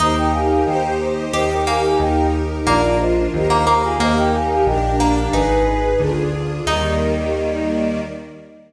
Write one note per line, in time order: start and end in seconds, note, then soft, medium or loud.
0.00 0.61 D#2 loud
0.00 1.15 D#4 medium
0.00 0.65 D#4 medium
0.00 0.65 G4 medium
0.00 0.66 A#4 medium
0.00 0.18 C5 medium
0.00 0.17 D#5 medium
0.17 0.32 D#5 medium
0.17 0.32 G5 medium
0.33 0.47 F5 medium
0.33 0.47 G#5 medium
0.49 0.63 F5 medium
0.49 0.63 G#5 medium
0.65 1.29 D#2 loud
0.65 1.32 D#4 loud
0.65 1.32 G4 loud
0.65 1.32 C5 loud
0.65 0.92 D#5 medium
0.65 0.92 G5 medium
1.33 1.94 D#2 loud
1.33 1.99 D#4 loud
1.33 1.99 G4 loud
1.33 1.63 G4 medium
1.33 1.99 A#4 medium
1.33 1.49 C5 medium
1.33 1.49 D#5 medium
1.51 1.64 D#5 medium
1.51 1.64 G5 medium
1.67 2.09 A#3 medium
1.67 1.80 F5 medium
1.67 1.80 G#5 medium
1.82 1.98 F5 medium
1.82 1.98 G#5 medium
1.99 2.61 D#2 loud
1.99 2.66 D#4 medium
1.99 2.66 G4 medium
1.99 2.66 A#4 loud
1.99 2.27 D#5 medium
1.99 2.27 G5 medium
2.66 3.28 A#1 loud
2.66 2.81 A#3 medium
2.66 3.33 D4 medium
2.66 3.33 F4 loud
2.66 2.97 A#4 medium
2.66 3.33 A#4 medium
2.66 2.97 D5 medium
3.00 3.27 C5 medium
3.00 3.27 D#5 medium
3.34 3.95 D#2 loud
3.34 3.99 D#4 medium
3.34 3.99 G4 medium
3.34 3.99 A#4 medium
3.34 3.82 C5 medium
3.34 3.82 D#5 medium
3.50 3.66 A#3 medium
3.67 3.96 A#3 medium
3.84 3.98 F4 medium
3.84 3.98 G#4 medium
4.00 4.61 D#2 loud
4.00 4.86 A#3 medium
4.00 4.66 D#4 medium
4.00 4.66 G4 medium
4.00 4.66 A#4 medium
4.00 4.15 C5 medium
4.00 4.15 D#5 medium
4.17 4.32 D#5 medium
4.17 4.32 G5 medium
4.33 4.49 F5 medium
4.33 4.49 G#5 medium
4.50 4.66 F5 medium
4.50 4.66 G#5 medium
4.66 5.28 A#1 loud
4.66 5.33 D4 loud
4.66 5.33 G4 medium
4.66 5.33 A#4 medium
4.66 4.96 D#5 medium
4.66 4.96 G5 medium
5.00 5.28 A#3 medium
5.32 5.95 G#1 loud
5.32 6.07 D#4 medium
5.32 6.00 D#4 medium
5.32 5.88 G#4 medium
5.32 5.98 G#4 medium
5.32 5.88 B4 medium
5.32 6.00 B4 loud
5.99 6.61 D2 loud
5.99 6.65 D4 medium
5.99 6.65 F4 medium
5.99 6.65 G#4 loud
6.66 8.00 D#2 loud
6.66 7.99 D#3 loud
6.66 7.99 G3 loud
6.66 7.99 A#3 medium
6.66 8.00 D#4 loud
6.66 8.01 D#5 loud